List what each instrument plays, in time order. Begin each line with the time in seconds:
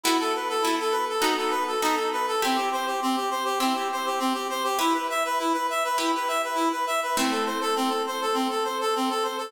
0.04 orchestral harp B3 E4 F#4 A4, clarinet E4
0.20 clarinet A4
0.35 clarinet B4
0.49 clarinet A4
0.62 orchestral harp B3 E4 F#4 A4, clarinet E4
0.80 clarinet A4
0.91 clarinet B4
1.09 clarinet A4
1.21 orchestral harp B3 D#4 F#4 A4, clarinet D#4
1.37 clarinet A4
1.50 clarinet B4
1.67 clarinet A4
1.82 orchestral harp B3 D#4 F#4 A4, clarinet D#4
1.96 clarinet A4
2.12 clarinet B4
2.28 clarinet A4
2.42 orchestral harp C4 E4 G4, clarinet C4
2.56 clarinet G4
2.72 clarinet C5
2.87 clarinet G4
3.02 clarinet C4
3.16 clarinet G4
3.31 clarinet C5
3.45 clarinet G4
3.60 clarinet C4, orchestral harp C4 E4 G4
3.74 clarinet G4
3.92 clarinet C5
4.06 clarinet G4
4.20 clarinet C4
4.34 clarinet G4
4.50 clarinet C5
4.64 clarinet G4
4.79 orchestral harp E4 G4 B4, clarinet E4
4.93 clarinet B4
5.10 clarinet E5
5.25 clarinet B4
5.39 clarinet E4
5.53 clarinet B4
5.70 clarinet E5
5.85 clarinet B4
5.98 clarinet E4, orchestral harp E4 G4 B4
6.15 clarinet B4
6.28 clarinet E5
6.44 clarinet B4
6.55 clarinet E4
6.72 clarinet B4
6.87 clarinet E5
7.03 clarinet B4
7.17 orchestral harp A3 C4 E4, clarinet C4
7.31 clarinet A4
7.46 clarinet C5
7.61 clarinet A4
7.76 clarinet C4
7.89 clarinet A4
8.07 clarinet C5
8.22 clarinet A4
8.34 clarinet C4
8.50 clarinet A4
8.64 clarinet C5
8.81 clarinet A4
8.96 clarinet C4
9.10 clarinet A4
9.23 clarinet C5
9.38 clarinet A4